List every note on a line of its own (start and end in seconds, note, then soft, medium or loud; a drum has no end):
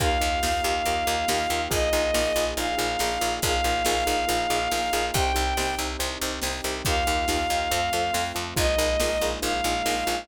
0.00 0.18 D#2 medium
0.00 1.70 A#3 medium
0.00 0.09 D#4 medium
0.00 1.70 D#4 medium
0.00 0.09 F4 medium
0.00 1.70 F4 medium
0.00 0.09 G4 loud
0.00 1.70 G4 medium
0.00 0.09 A#4 medium
0.00 1.62 F5 loud
0.00 kick loud
0.00 closed hi-hat medium
0.21 0.40 D#2 medium
0.21 0.29 D#4 medium
0.21 0.29 F4 medium
0.21 0.29 G4 medium
0.21 0.29 A#4 medium
0.43 0.61 D#2 medium
0.43 0.52 D#4 medium
0.43 0.52 F4 medium
0.43 0.52 G4 medium
0.43 0.52 A#4 medium
0.43 snare loud
0.64 0.82 D#2 medium
0.64 0.73 D#4 medium
0.64 0.73 F4 medium
0.64 0.73 G4 medium
0.64 0.73 A#4 medium
0.85 1.04 D#2 medium
0.85 0.95 D#4 medium
0.85 0.95 F4 medium
0.85 0.95 G4 medium
0.85 0.95 A#4 medium
0.85 closed hi-hat medium
1.07 1.25 D#2 medium
1.07 1.15 D#4 medium
1.07 1.15 F4 medium
1.07 1.15 G4 medium
1.07 1.15 A#4 medium
1.28 1.47 D#2 medium
1.28 1.38 D#4 medium
1.28 1.38 F4 medium
1.28 1.38 G4 medium
1.28 1.38 A#4 medium
1.28 snare loud
1.50 1.68 D#2 medium
1.50 1.60 D#4 medium
1.50 1.60 F4 medium
1.50 1.60 G4 medium
1.50 1.60 A#4 medium
1.71 1.90 A#1 medium
1.71 3.41 A#3 medium
1.71 1.79 D#4 medium
1.71 3.41 D#4 medium
1.71 1.79 F4 medium
1.71 3.41 F4 medium
1.71 1.79 G#4 medium
1.71 3.41 G#4 medium
1.71 1.79 A#4 loud
1.71 2.44 D#5 loud
1.71 kick medium
1.71 closed hi-hat loud
1.93 2.11 A#1 medium
1.93 2.02 D#4 medium
1.93 2.02 F4 medium
1.93 2.02 G#4 medium
1.93 2.02 A#4 medium
2.14 2.32 A#1 medium
2.14 2.22 D#4 medium
2.14 2.22 F4 medium
2.14 2.22 G#4 medium
2.14 2.22 A#4 medium
2.14 snare loud
2.36 2.54 A#1 medium
2.36 2.45 D#4 medium
2.36 2.45 F4 medium
2.36 2.45 G#4 medium
2.36 2.45 A#4 medium
2.57 2.75 A#1 medium
2.57 2.66 D#4 medium
2.57 2.66 F4 medium
2.57 2.66 G#4 medium
2.57 2.66 A#4 medium
2.57 3.34 F5 loud
2.57 closed hi-hat medium
2.78 2.97 A#1 medium
2.78 2.86 D#4 medium
2.78 2.86 F4 medium
2.78 2.86 G#4 medium
2.78 2.86 A#4 medium
2.99 3.18 A#1 medium
2.99 3.09 D#4 medium
2.99 3.09 F4 medium
2.99 3.09 G#4 medium
2.99 3.09 A#4 medium
2.99 snare medium
3.21 3.40 A#1 medium
3.21 3.29 D#4 medium
3.21 3.29 F4 medium
3.21 3.29 G#4 medium
3.21 3.29 A#4 medium
3.42 3.61 A#1 loud
3.42 5.13 A#3 medium
3.42 3.52 D#4 medium
3.42 5.13 D#4 medium
3.42 3.52 F4 medium
3.42 5.13 F4 medium
3.42 3.52 G#4 loud
3.42 5.13 G#4 medium
3.42 3.52 A#4 medium
3.42 5.05 F5 loud
3.42 kick medium
3.42 closed hi-hat medium
3.64 3.82 A#1 medium
3.64 3.73 D#4 medium
3.64 3.73 F4 medium
3.64 3.73 G#4 medium
3.64 3.73 A#4 medium
3.85 4.04 A#1 loud
3.85 3.94 D#4 medium
3.85 3.94 F4 medium
3.85 3.94 G#4 medium
3.85 3.94 A#4 medium
3.85 snare medium
4.06 4.25 A#1 medium
4.06 4.15 D#4 medium
4.06 4.15 F4 medium
4.06 4.15 G#4 medium
4.06 4.15 A#4 medium
4.28 4.47 A#1 medium
4.28 4.36 D#4 medium
4.28 4.36 F4 medium
4.28 4.36 G#4 medium
4.28 4.36 A#4 medium
4.28 closed hi-hat medium
4.50 4.68 A#1 medium
4.50 4.59 D#4 medium
4.50 4.59 F4 medium
4.50 4.59 G#4 medium
4.50 4.59 A#4 medium
4.72 4.90 A#1 medium
4.72 4.80 D#4 medium
4.72 4.80 F4 medium
4.72 4.80 G#4 medium
4.72 4.80 A#4 medium
4.72 snare medium
4.93 5.11 A#1 medium
4.93 5.02 D#4 medium
4.93 5.02 F4 medium
4.93 5.02 G#4 medium
4.93 5.02 A#4 medium
5.14 5.32 C2 loud
5.14 6.84 C4 medium
5.14 6.84 D#4 medium
5.14 5.24 D#4 medium
5.14 6.84 G4 medium
5.14 5.24 G4 medium
5.14 5.24 C5 loud
5.14 5.74 G5 loud
5.14 kick loud
5.14 closed hi-hat medium
5.34 5.54 C2 medium
5.34 5.43 D#4 medium
5.34 5.43 G4 medium
5.34 5.43 C5 medium
5.57 5.75 C2 medium
5.57 5.66 D#4 medium
5.57 5.66 G4 medium
5.57 5.66 C5 medium
5.57 snare medium
5.79 5.97 C2 medium
5.79 5.87 D#4 medium
5.79 5.87 G4 medium
5.79 5.87 C5 medium
5.99 6.18 C2 medium
5.99 6.08 D#4 medium
5.99 6.08 G4 medium
5.99 6.08 C5 medium
5.99 closed hi-hat medium
6.22 6.40 C2 medium
6.22 6.31 D#4 medium
6.22 6.31 G4 medium
6.22 6.31 C5 medium
6.42 6.61 C2 medium
6.42 6.51 D#4 medium
6.42 6.51 G4 medium
6.42 6.51 C5 medium
6.42 snare medium
6.64 6.82 C2 medium
6.64 6.73 D#4 medium
6.64 6.73 G4 medium
6.64 6.73 C5 medium
6.85 7.04 D#2 loud
6.85 7.71 A#3 medium
6.85 7.71 D#4 medium
6.85 6.96 D#4 medium
6.85 7.71 F4 medium
6.85 6.96 F4 medium
6.85 7.71 G4 medium
6.85 6.96 G4 medium
6.85 6.96 A#4 medium
6.85 8.24 F5 loud
6.85 kick medium
6.85 closed hi-hat medium
7.07 7.25 D#2 medium
7.07 7.16 D#4 medium
7.07 7.16 F4 medium
7.07 7.16 G4 medium
7.07 7.16 A#4 medium
7.28 7.47 D#2 medium
7.28 7.37 D#4 medium
7.28 7.37 F4 medium
7.28 7.37 G4 medium
7.28 7.37 A#4 medium
7.28 snare medium
7.50 7.68 D#2 medium
7.50 7.60 D#4 medium
7.50 7.60 F4 medium
7.50 7.60 G4 medium
7.50 7.60 A#4 medium
7.71 7.90 F2 loud
7.71 8.57 A3 medium
7.71 8.57 C4 medium
7.71 7.80 F4 medium
7.71 8.56 F4 medium
7.71 7.80 A4 medium
7.71 7.80 C5 medium
7.71 closed hi-hat medium
7.93 8.11 F2 medium
7.93 8.02 F4 medium
7.93 8.02 A4 medium
7.93 8.02 C5 medium
8.13 8.32 F2 medium
8.13 8.22 F4 medium
8.13 8.22 A4 medium
8.13 8.22 C5 medium
8.13 snare medium
8.35 8.54 F2 medium
8.35 8.43 F4 medium
8.35 8.43 A4 medium
8.35 8.43 C5 medium
8.56 8.75 A#1 loud
8.56 10.26 G#3 medium
8.56 10.26 A#3 medium
8.56 8.65 D#4 medium
8.56 10.26 D#4 medium
8.56 8.65 F4 loud
8.56 10.26 F4 medium
8.56 8.65 G#4 medium
8.56 8.65 A#4 medium
8.56 9.26 D#5 loud
8.56 kick loud
8.56 closed hi-hat medium
8.78 8.97 A#1 medium
8.78 8.87 D#4 medium
8.78 8.87 F4 medium
8.78 8.87 G#4 medium
8.78 8.87 A#4 medium
9.00 9.18 A#1 medium
9.00 9.10 D#4 medium
9.00 9.10 F4 medium
9.00 9.10 G#4 medium
9.00 9.10 A#4 medium
9.00 snare loud
9.21 9.40 A#1 medium
9.21 9.31 D#4 medium
9.21 9.31 F4 medium
9.21 9.31 G#4 medium
9.21 9.31 A#4 medium
9.42 9.61 A#1 medium
9.42 9.51 D#4 medium
9.42 9.51 F4 medium
9.42 9.51 G#4 medium
9.42 9.51 A#4 medium
9.42 10.20 F5 loud
9.42 closed hi-hat medium
9.64 9.82 A#1 medium
9.64 9.73 D#4 medium
9.64 9.73 F4 medium
9.64 9.73 G#4 medium
9.64 9.73 A#4 medium
9.86 10.04 A#1 medium
9.86 9.94 D#4 medium
9.86 9.94 F4 medium
9.86 9.94 G#4 medium
9.86 9.94 A#4 medium
9.86 snare medium
10.07 10.25 A#1 medium
10.07 10.15 D#4 medium
10.07 10.15 F4 medium
10.07 10.15 G#4 medium
10.07 10.15 A#4 medium